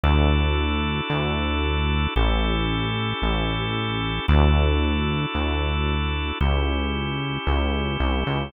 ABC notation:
X:1
M:4/4
L:1/8
Q:1/4=113
K:D
V:1 name="Drawbar Organ"
[DEFA]8 | [CEGA]8 | [DEFA]8 | [CEG]8 |]
V:2 name="Synth Bass 1" clef=bass
D,,4 D,,4 | A,,,4 A,,,4 | D,,4 D,,4 | C,,4 C,,2 =C,, ^C,, |]